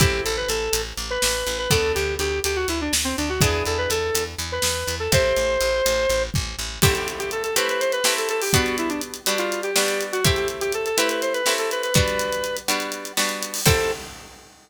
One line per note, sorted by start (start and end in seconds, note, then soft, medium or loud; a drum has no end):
0.00 0.20 A1 loud
0.00 1.54 C4 medium
0.00 1.54 E4 medium
0.00 0.22 G4 medium
0.00 1.54 G4 medium
0.00 1.54 A4 medium
0.00 kick loud
0.00 closed hi-hat medium
0.25 0.46 A1 medium
0.25 0.36 A4 medium
0.25 closed hi-hat medium
0.37 0.48 B4 medium
0.48 0.69 A1 medium
0.48 0.82 A4 medium
0.48 closed hi-hat medium
0.73 0.93 A1 medium
0.73 closed hi-hat loud
0.97 1.18 A1 medium
0.97 closed hi-hat medium
1.10 1.58 B4 medium
1.22 1.44 A1 medium
1.22 snare loud
1.47 1.67 A1 medium
1.47 closed hi-hat medium
1.58 1.70 B4 medium
1.70 1.93 D2 medium
1.70 3.24 B3 medium
1.70 3.24 D4 medium
1.70 3.24 F#4 medium
1.70 3.24 A4 medium
1.70 1.92 A4 medium
1.70 kick medium
1.70 closed hi-hat medium
1.95 2.17 D2 medium
1.95 2.14 G4 medium
1.95 closed hi-hat medium
2.19 2.40 D2 medium
2.19 2.40 G4 medium
2.19 closed hi-hat medium
2.44 2.65 D2 medium
2.44 2.56 G4 medium
2.44 closed hi-hat medium
2.56 2.67 F#4 medium
2.68 2.89 D2 medium
2.68 2.80 E4 medium
2.68 closed hi-hat medium
2.81 2.93 D4 medium
2.93 3.13 D2 medium
2.93 snare loud
3.04 3.16 C4 medium
3.17 3.39 D2 medium
3.17 3.29 D4 medium
3.17 closed hi-hat medium
3.29 3.41 F#4 medium
3.41 3.62 E2 loud
3.41 4.95 B3 medium
3.41 4.95 D4 medium
3.41 4.95 E4 medium
3.41 4.95 G#4 medium
3.41 3.64 G#4 medium
3.41 kick loud
3.41 closed hi-hat loud
3.65 3.87 E2 medium
3.65 3.78 A4 medium
3.65 closed hi-hat medium
3.78 3.89 B4 medium
3.90 4.11 E2 medium
3.90 4.24 A4 medium
3.90 closed hi-hat medium
4.15 4.35 E2 medium
4.15 closed hi-hat loud
4.39 4.59 E2 medium
4.39 closed hi-hat medium
4.52 4.95 B4 medium
4.62 4.84 E2 medium
4.62 snare loud
4.87 5.08 E2 medium
4.87 closed hi-hat medium
5.00 5.11 A4 medium
5.12 5.33 A1 loud
5.12 6.66 C4 medium
5.12 6.66 E4 medium
5.12 6.66 G4 medium
5.12 6.66 A4 medium
5.12 6.23 C5 medium
5.12 kick medium
5.12 closed hi-hat medium
5.36 5.58 A1 medium
5.36 closed hi-hat medium
5.61 5.82 A1 medium
5.61 closed hi-hat medium
5.86 6.07 A1 medium
5.86 closed hi-hat medium
6.09 6.30 A1 medium
6.09 closed hi-hat medium
6.34 6.56 A1 medium
6.34 kick medium
6.59 6.79 A1 medium
6.82 7.49 A3 medium
6.82 7.49 C4 medium
6.82 7.49 E4 medium
6.82 6.94 G4 medium
6.82 7.49 G4 loud
6.82 kick loud
6.82 crash loud
6.95 7.08 G4 medium
6.95 closed hi-hat medium
7.08 closed hi-hat medium
7.19 7.30 G4 medium
7.19 closed hi-hat medium
7.31 7.43 A4 medium
7.31 closed hi-hat medium
7.43 7.55 A4 medium
7.43 closed hi-hat medium
7.56 8.00 A3 medium
7.56 8.00 C4 medium
7.56 8.00 E4 medium
7.56 8.00 G4 medium
7.56 7.68 B4 medium
7.56 closed hi-hat medium
7.69 7.81 B4 medium
7.69 closed hi-hat medium
7.80 7.92 C5 medium
7.80 closed hi-hat medium
7.92 8.14 B4 medium
7.92 closed hi-hat medium
8.04 8.49 A3 medium
8.04 8.49 C4 medium
8.04 8.49 E4 medium
8.04 8.49 G4 medium
8.04 snare loud
8.17 8.29 A4 medium
8.17 closed hi-hat medium
8.29 8.41 A4 medium
8.29 closed hi-hat medium
8.41 8.53 G4 medium
8.41 open hi-hat medium
8.53 9.20 G3 medium
8.53 9.20 B3 loud
8.53 9.20 D4 medium
8.53 9.20 F#4 medium
8.53 8.76 F#4 medium
8.53 kick medium
8.53 closed hi-hat medium
8.66 closed hi-hat medium
8.78 8.90 E4 medium
8.78 closed hi-hat medium
8.89 9.01 D4 medium
8.89 closed hi-hat medium
9.01 closed hi-hat medium
9.14 closed hi-hat medium
9.26 9.71 G3 medium
9.26 9.71 B3 medium
9.26 9.71 D4 medium
9.26 9.71 F#4 medium
9.26 closed hi-hat medium
9.38 9.61 F4 medium
9.38 closed hi-hat medium
9.52 closed hi-hat medium
9.63 10.04 G4 medium
9.63 closed hi-hat medium
9.76 10.20 G3 medium
9.76 10.20 B3 medium
9.76 10.20 D4 medium
9.76 10.20 F#4 medium
9.76 snare loud
9.88 closed hi-hat medium
10.01 closed hi-hat medium
10.12 10.24 F#4 medium
10.12 closed hi-hat medium
10.24 10.90 A3 medium
10.24 10.90 C4 medium
10.24 10.90 E4 medium
10.24 10.90 G4 medium
10.24 10.36 G4 medium
10.24 kick loud
10.24 closed hi-hat medium
10.36 10.48 G4 medium
10.36 closed hi-hat medium
10.48 closed hi-hat medium
10.61 10.72 G4 medium
10.61 closed hi-hat medium
10.72 10.85 A4 medium
10.72 closed hi-hat medium
10.86 10.97 A4 medium
10.86 closed hi-hat medium
10.97 11.41 A3 medium
10.97 11.41 C4 medium
10.97 11.41 E4 medium
10.97 11.41 G4 medium
10.97 11.09 B4 medium
10.97 closed hi-hat loud
11.09 11.21 B4 medium
11.09 closed hi-hat medium
11.22 11.33 C5 medium
11.22 closed hi-hat medium
11.33 11.53 B4 medium
11.33 closed hi-hat medium
11.46 11.90 A3 medium
11.46 11.90 C4 medium
11.46 11.90 E4 medium
11.46 11.90 G4 medium
11.46 snare medium
11.58 11.70 A4 medium
11.58 closed hi-hat medium
11.71 11.82 B4 medium
11.71 closed hi-hat medium
11.83 11.94 B4 medium
11.83 closed hi-hat medium
11.94 12.61 G3 medium
11.94 12.61 B3 medium
11.94 12.61 D4 medium
11.94 12.61 F#4 medium
11.94 12.56 B4 medium
11.94 kick loud
11.94 closed hi-hat medium
12.08 closed hi-hat medium
12.19 closed hi-hat medium
12.32 closed hi-hat medium
12.44 closed hi-hat medium
12.57 closed hi-hat medium
12.68 13.12 G3 medium
12.68 13.12 B3 medium
12.68 13.12 D4 medium
12.68 13.12 F#4 medium
12.68 closed hi-hat medium
12.80 closed hi-hat medium
12.92 closed hi-hat medium
13.05 closed hi-hat medium
13.17 13.61 G3 medium
13.17 13.61 B3 medium
13.17 13.61 D4 medium
13.17 13.61 F#4 medium
13.17 snare medium
13.29 closed hi-hat medium
13.42 closed hi-hat medium
13.54 open hi-hat medium
13.66 13.91 C4 medium
13.66 13.91 E4 medium
13.66 13.91 G4 loud
13.66 13.91 A4 loud
13.66 kick loud
13.66 crash loud